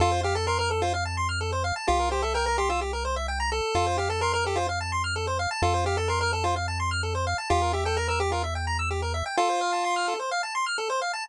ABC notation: X:1
M:4/4
L:1/16
Q:1/4=128
K:F
V:1 name="Lead 1 (square)"
F2 G A B B A F z8 | F2 G A B B G F z8 | F2 G A B B G F z8 | F2 G A B B A F z8 |
F2 G A B B G F z8 | F8 z8 |]
V:2 name="Lead 1 (square)"
A c f a c' f' A c f a c' f' A c f a | G B c e g b c' e' G B c e g b A2- | A c f a c' f' A c f a c' f' A c f a | A c f a c' f' A c f a c' f' A c f a |
G B e g b e' G B e g b e' G B e g | A c f a c' f' A c f a c' f' A c f a |]
V:3 name="Synth Bass 1" clef=bass
F,,16 | C,,16 | F,,16 | F,,16 |
E,,16 | z16 |]